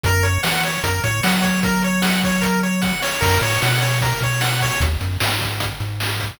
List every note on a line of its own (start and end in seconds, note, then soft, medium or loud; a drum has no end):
0.03 0.38 F#2 loud
0.03 0.24 A#4 medium
0.03 kick loud
0.03 closed hi-hat medium
0.23 0.41 C#5 medium
0.23 closed hi-hat medium
0.43 0.78 E3 medium
0.43 0.61 F#5 medium
0.43 snare loud
0.64 0.82 C#5 medium
0.64 closed hi-hat medium
0.84 1.00 F#2 medium
0.84 1.01 A#4 medium
0.84 kick medium
0.84 closed hi-hat loud
1.03 1.21 A2 medium
1.03 1.22 C#5 medium
1.03 kick medium
1.03 closed hi-hat medium
1.23 2.93 F#3 medium
1.23 1.42 F#5 medium
1.23 snare loud
1.42 1.60 C#5 medium
1.42 kick medium
1.42 closed hi-hat medium
1.63 1.82 A#4 medium
1.63 kick loud
1.63 closed hi-hat medium
1.83 2.02 C#5 medium
1.83 closed hi-hat medium
2.02 2.20 F#5 medium
2.02 snare loud
2.23 2.42 C#5 medium
2.23 kick medium
2.23 closed hi-hat medium
2.41 2.59 A#4 medium
2.41 kick medium
2.41 closed hi-hat medium
2.63 2.81 C#5 medium
2.63 closed hi-hat medium
2.82 3.00 F#5 medium
2.82 kick medium
2.82 snare medium
3.02 3.20 C#5 medium
3.02 snare medium
3.21 3.39 F#2 loud
3.21 3.39 A#4 medium
3.21 kick loud
3.21 crash loud
3.42 3.58 A2 medium
3.42 3.61 C#5 medium
3.42 closed hi-hat medium
3.62 4.13 B2 medium
3.62 3.81 F#5 medium
3.62 snare medium
3.81 3.99 C#5 medium
3.81 closed hi-hat medium
4.01 4.20 A#4 medium
4.01 kick medium
4.01 closed hi-hat medium
4.21 4.71 B2 medium
4.21 4.41 C#5 medium
4.21 kick medium
4.21 closed hi-hat medium
4.41 4.59 F#5 medium
4.41 snare loud
4.61 4.80 C#5 medium
4.61 kick medium
4.61 open hi-hat medium
4.80 4.97 D#2 loud
4.80 kick loud
4.80 closed hi-hat loud
5.01 5.18 F#2 medium
5.01 closed hi-hat medium
5.20 5.72 G#2 medium
5.20 snare loud
5.41 kick medium
5.41 closed hi-hat medium
5.60 kick medium
5.60 closed hi-hat loud
5.80 6.31 G#2 medium
5.80 closed hi-hat medium
6.00 snare medium
6.20 kick medium
6.20 closed hi-hat medium